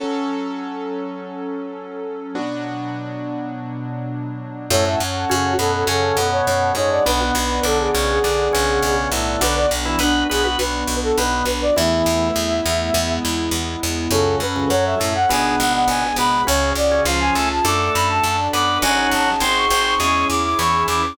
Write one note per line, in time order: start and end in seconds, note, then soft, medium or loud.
0.00 2.31 F#3 medium
0.00 2.33 F#3 medium
0.00 2.31 C#4 medium
0.00 2.33 C#4 medium
0.00 2.31 A4 medium
0.00 2.33 A4 medium
2.35 4.69 B2 medium
2.35 4.69 F#3 medium
2.35 4.66 B3 medium
2.35 4.66 D4 medium
2.35 4.69 D4 medium
2.35 4.66 F#4 medium
4.70 4.95 F#2 loud
4.70 4.85 A2 medium
4.70 4.85 A3 loud
4.70 7.01 C#4 medium
4.70 7.01 F#4 medium
4.70 7.01 A4 medium
4.70 4.85 C#5 loud
4.70 7.04 C#5 medium
4.70 7.04 F#5 medium
4.70 7.04 A5 medium
4.85 4.99 A2 medium
4.85 4.99 A3 medium
4.85 4.99 E5 medium
5.00 5.25 F#2 medium
5.29 5.56 F#2 medium
5.29 5.54 C#3 medium
5.29 5.54 C#4 medium
5.29 5.53 F#4 loud
5.59 5.84 F#2 medium
5.59 5.84 B2 medium
5.59 5.84 B3 medium
5.59 5.73 A4 medium
5.74 5.87 A4 medium
5.87 6.12 F#2 loud
5.87 6.17 C#3 medium
5.87 6.17 C#4 medium
5.87 6.28 A4 medium
6.17 6.42 F#2 medium
6.17 6.73 B2 medium
6.17 6.73 B3 medium
6.32 6.46 C#5 medium
6.47 6.72 F#2 medium
6.47 6.71 C#5 medium
6.75 7.00 F#2 medium
6.75 7.03 G#2 medium
6.75 7.03 G#3 loud
6.75 6.90 C#5 loud
6.91 7.05 D5 medium
7.06 7.31 B1 loud
7.06 7.20 B2 medium
7.06 7.20 B3 loud
7.06 9.36 B3 medium
7.06 9.36 D4 medium
7.06 9.36 F#4 medium
7.06 7.62 B4 loud
7.06 9.40 B4 medium
7.06 9.40 D5 medium
7.06 9.40 F#5 medium
7.21 7.35 B2 medium
7.21 7.35 B3 loud
7.35 7.60 B1 loud
7.63 7.88 B1 medium
7.63 7.91 D3 medium
7.63 7.91 D4 medium
7.63 7.79 A4 loud
7.79 8.07 G#4 medium
7.94 8.20 B1 loud
7.94 8.19 C#3 medium
7.94 8.19 C#4 loud
8.09 8.93 G#4 loud
8.24 8.49 B1 medium
8.24 8.48 D3 medium
8.24 8.48 D4 loud
8.53 8.80 B1 loud
8.53 9.10 C#3 medium
8.53 9.10 C#4 loud
8.82 9.07 B1 medium
9.12 9.37 B1 loud
9.12 9.41 A2 medium
9.12 9.41 A3 medium
9.41 9.66 B1 loud
9.41 9.66 D3 loud
9.41 11.71 B3 medium
9.41 11.74 B3 medium
9.41 11.71 D4 medium
9.41 9.66 D4 loud
9.41 11.74 D4 medium
9.41 11.71 F#4 medium
9.41 11.74 F#4 medium
9.41 9.55 B4 medium
9.56 9.70 D5 medium
9.71 9.96 B1 loud
9.85 9.99 E3 medium
9.85 9.99 E4 loud
9.99 10.24 B1 medium
9.99 10.24 B3 medium
9.99 10.28 D4 medium
9.99 10.24 B4 loud
10.29 10.56 B1 medium
10.29 10.44 B3 medium
10.29 10.43 G#4 medium
10.29 10.44 B4 medium
10.44 10.58 B3 medium
10.44 10.58 F#4 medium
10.44 10.58 B4 medium
10.59 10.84 B1 medium
10.59 10.96 B4 medium
10.87 11.12 B1 medium
11.03 11.17 A4 loud
11.17 11.43 B1 medium
11.17 11.45 B2 medium
11.17 11.45 B3 medium
11.17 11.45 B4 loud
11.45 11.70 B1 medium
11.45 11.61 B4 medium
11.62 11.76 D5 loud
11.76 12.29 E2 loud
11.76 12.03 E2 loud
11.76 12.29 E3 loud
11.76 12.93 A3 medium
11.76 12.92 A3 medium
11.76 12.93 B3 medium
11.76 12.92 B3 medium
11.76 12.93 E4 medium
11.76 12.92 E4 medium
11.76 13.13 E5 medium
12.06 12.31 E2 loud
12.36 12.61 E2 medium
12.66 12.91 E2 loud
12.94 13.19 E2 loud
12.94 14.09 G#3 medium
12.94 14.11 G#3 medium
12.94 14.09 B3 medium
12.94 14.11 B3 medium
12.94 14.09 E4 medium
12.94 14.11 E4 medium
13.25 13.50 E2 medium
13.51 13.76 E2 medium
13.83 14.08 E2 medium
14.11 14.40 C#2 loud
14.11 14.36 F#2 loud
14.11 14.40 C#3 loud
14.11 15.27 C#4 medium
14.11 14.70 C#4 medium
14.11 15.27 F#4 medium
14.11 14.70 F#4 medium
14.11 15.27 A4 medium
14.11 14.36 A4 loud
14.11 14.70 A4 medium
14.40 14.65 F#2 medium
14.40 14.68 B4 medium
14.56 14.70 C#2 medium
14.56 14.70 C#3 medium
14.70 14.95 F#2 medium
14.70 14.95 F#3 loud
14.70 15.29 C#4 medium
14.70 15.29 A4 medium
14.70 15.29 C#5 medium
14.70 14.85 C#5 medium
14.85 15.14 E5 loud
15.00 15.26 F#2 medium
15.00 15.14 A2 medium
15.00 15.14 A3 loud
15.15 15.29 F#5 medium
15.29 15.55 G#1 loud
15.29 16.04 B2 medium
15.29 16.44 B3 medium
15.29 16.04 B3 medium
15.29 15.88 B3 medium
15.29 16.44 D4 medium
15.29 15.88 D4 medium
15.29 16.44 G#4 medium
15.29 15.88 G#4 medium
15.29 15.56 G#5 medium
15.59 15.85 G#1 loud
15.59 15.73 F#5 medium
15.74 15.87 F#5 medium
15.88 16.13 G#1 medium
15.88 16.47 G#3 medium
15.88 16.47 B3 medium
15.88 16.47 G#4 medium
15.88 16.16 G#5 medium
16.16 16.41 G#1 medium
16.16 16.43 B2 medium
16.16 16.43 B3 loud
16.16 16.43 B5 loud
16.47 16.73 C#2 loud
16.47 16.73 C#3 medium
16.47 16.73 C#4 loud
16.47 17.05 C#4 medium
16.47 17.05 F#4 medium
16.47 17.06 F#4 medium
16.47 17.05 G#4 medium
16.47 16.71 C#5 loud
16.75 17.00 C#2 medium
16.75 17.02 D5 loud
16.91 17.05 C#3 medium
16.91 17.05 C#4 medium
17.05 17.30 C#2 loud
17.05 17.34 F3 medium
17.05 17.63 C#4 medium
17.05 17.64 C#4 medium
17.05 17.63 F4 medium
17.05 17.64 F4 medium
17.05 17.34 F4 medium
17.05 17.63 G#4 medium
17.05 17.64 G#4 medium
17.05 17.20 F5 medium
17.21 17.49 G#5 loud
17.35 17.60 C#2 medium
17.35 17.49 A3 medium
17.35 17.49 A4 loud
17.50 17.64 A5 medium
17.65 17.90 F#2 loud
17.65 18.37 A3 medium
17.65 18.80 D4 medium
17.65 18.23 D4 medium
17.65 18.80 F#4 medium
17.65 18.24 F#4 medium
17.65 18.37 A4 medium
17.65 18.80 A4 medium
17.65 18.23 A4 medium
17.65 17.92 D6 medium
17.94 18.20 F#2 loud
17.94 18.08 B5 medium
18.09 18.23 A5 loud
18.23 18.49 F#2 medium
18.23 18.81 D4 medium
18.23 18.81 A4 medium
18.23 18.81 D5 medium
18.23 18.47 A5 medium
18.53 18.78 F#2 medium
18.53 18.78 B3 medium
18.53 18.78 B4 medium
18.53 18.79 D6 medium
18.82 19.07 G#1 loud
18.82 19.31 F#3 loud
18.82 19.40 C#4 medium
18.82 19.40 D#4 medium
18.82 19.40 F#4 medium
18.82 19.31 F#4 loud
18.82 19.40 F#4 medium
18.82 19.40 G#4 medium
18.82 19.10 G#5 loud
19.12 19.37 G#1 medium
19.12 19.40 A5 medium
19.40 19.65 G#1 loud
19.40 19.99 C4 medium
19.40 19.67 C4 medium
19.40 19.99 D#4 medium
19.40 19.99 F#4 medium
19.40 19.99 G#4 medium
19.40 19.67 C5 medium
19.40 19.55 C6 medium
19.56 19.81 C#6 medium
19.70 19.95 G#1 loud
19.70 19.94 C4 medium
19.70 19.94 C5 loud
19.85 19.99 C#6 medium
20.00 20.25 E2 loud
20.00 20.27 G#3 medium
20.00 21.16 C#4 medium
20.00 21.15 C#4 medium
20.00 21.16 E4 medium
20.00 21.15 E4 medium
20.00 21.16 G#4 medium
20.00 20.27 G#4 loud
20.00 21.15 G#4 medium
20.00 20.25 C#6 medium
20.30 20.55 E2 medium
20.30 20.44 D6 medium
20.44 20.58 D6 medium
20.59 20.84 E2 medium
20.59 20.87 E3 medium
20.59 20.87 E4 loud
20.59 20.83 C#6 loud
20.88 21.13 E2 medium
20.88 21.02 E3 medium
20.88 21.02 E4 medium
20.88 21.14 D6 medium